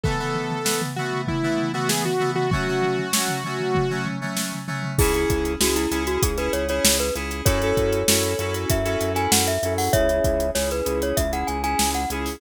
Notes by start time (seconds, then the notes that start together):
0.03 E3 A3 B3 A4, kick, floor tom
0.19 E3 A3 B3, floor tom
0.35 floor tom
0.51 floor tom
0.64 E3 A3 B3, snare
0.82 floor tom
0.96 E3 A3 B3 F#4, floor tom
1.12 floor tom
1.28 E4, kick, floor tom
1.43 E3 A3 B3, floor tom
1.58 floor tom
1.73 E3 A3 B3 F#4, floor tom
1.89 G#4, snare
2.05 F#4, floor tom
2.20 E3 A3 B3, floor tom
2.35 F#4, floor tom
2.51 F#3 A3 C#4 F#4, kick, floor tom
2.67 F#3 A3 C#4, floor tom
2.82 floor tom
2.98 floor tom
3.13 F#3 A3 C#4, snare
3.28 floor tom
3.44 F#3 A3 C#4, floor tom
3.60 floor tom
3.75 kick, floor tom
3.90 F#3 A3 C#4, floor tom
4.06 floor tom
4.21 F#3 A3 C#4, floor tom
4.37 snare
4.52 floor tom
4.68 F#3 A3 C#4, floor tom
4.83 floor tom
4.98 C#2 C#4 E4 G#4, kick, crash
5.14 C#4 E4 G#4, closed hi-hat
5.30 C#2, kick, closed hi-hat
5.45 closed hi-hat
5.60 C#2 C#4 E4 F#4 G#4, snare
5.76 E4, closed hi-hat
5.91 C#2 C#4 E4 G#4, closed hi-hat
6.07 F#4, closed hi-hat
6.22 C#2 G#4, kick, closed hi-hat
6.38 C#4 E4 G#4 B4, closed hi-hat
6.53 C#2 C#5, closed hi-hat
6.69 C#4 E4 G#4 C#5, closed hi-hat
6.84 C#2, snare
6.99 B4, closed hi-hat
7.15 C#2 C#4 E4 G#4, closed hi-hat
7.31 closed hi-hat
7.45 F#2 C#4 E4 F#4 A4 C#5, kick, closed hi-hat
7.62 C#4 E4 F#4 A4, closed hi-hat
7.77 F#2, kick, closed hi-hat
7.93 closed hi-hat
8.08 F#2 C#4 E4 F#4 A4, snare
8.23 closed hi-hat
8.39 F#2 C#4 E4 F#4 A4, closed hi-hat
8.54 closed hi-hat
8.70 F#2 E5, kick, closed hi-hat
8.85 C#4 E4 F#4 A4, closed hi-hat
9.01 F#2, closed hi-hat
9.14 C#4 E4 F#4 A4 G#5, closed hi-hat
9.32 F#2 F#5, snare
9.47 E5, closed hi-hat
9.63 F#2 C#4 E4 F#4 A4, closed hi-hat
9.78 F#5, open hi-hat
9.93 C#2 C#4 E4 G#4 C#5 E5, kick, closed hi-hat
10.09 C#4 E4 G#4, closed hi-hat
10.24 C#2, kick, closed hi-hat
10.40 closed hi-hat
10.55 C#2 C#4 E4 G#4 C#5, snare
10.71 B4, closed hi-hat
10.85 C#2 C#4 E4 G#4, closed hi-hat
11.02 C#5, closed hi-hat
11.17 C#2 E5, kick, closed hi-hat
11.32 C#4 E4 G#4 F#5, closed hi-hat
11.47 C#2 G#5, closed hi-hat
11.63 C#4 E4 G#4 G#5, closed hi-hat
11.79 C#2, snare
11.94 F#5, closed hi-hat
12.10 C#2 C#4 E4 G#4, closed hi-hat
12.26 open hi-hat